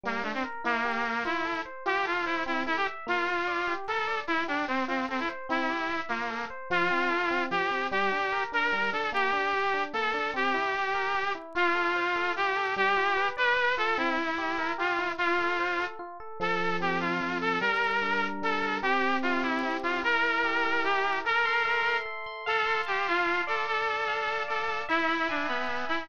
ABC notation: X:1
M:6/8
L:1/16
Q:3/8=99
K:F
V:1 name="Lead 2 (sawtooth)"
B,2 A, C z2 | B,6 E4 z2 | G2 F2 E2 E2 E G z2 | F8 A4 |
E2 D2 C2 C2 C E z2 | E6 B,4 z2 | F8 G4 | G6 B4 A2 |
G8 A4 | G10 z2 | F8 G4 | G6 =B4 A2 |
E8 F4 | F8 z4 | A4 G2 F4 A2 | B8 A4 |
G4 F2 E4 F2 | B8 G4 | B8 z4 | A4 G2 F4 A2 |
A8 A4 | E4 D2 =B,4 E2 |]
V:2 name="Electric Piano 1"
G,2 D2 B2 | E2 G2 B2 F2 A2 c2 | F2 A2 c2 C2 A2 e2 | B,2 F2 d2 G2 B2 d2 |
E2 G2 c2 F2 A2 c2 | C2 G2 e2 F2 A2 c2 | F,2 C2 A2 C2 F,2 C2 | G,2 D2 B2 D2 G,2 D2 |
B,2 D2 G2 D2 B,2 D2 | C2 E2 G2 B2 G2 E2 | F2 A2 c2 A2 F2 A2 | G,2 F2 =B2 d2 B2 F2 |
C2 E2 G2 B2 G2 E2 | F2 A2 c2 A2 F2 A2 | F,2 A2 C2 A2 F,2 A2 | G,2 B2 D2 B2 G,2 B2 |
C2 G2 E2 G2 C2 G2 | E2 B2 G2 B2 E2 B2 | A2 c'2 e2 c'2 A2 c'2 | f2 c'2 a2 c'2 f2 d2- |
d2 a2 f2 a2 d2 a2 | e2 =b2 ^g2 b2 e2 b2 |]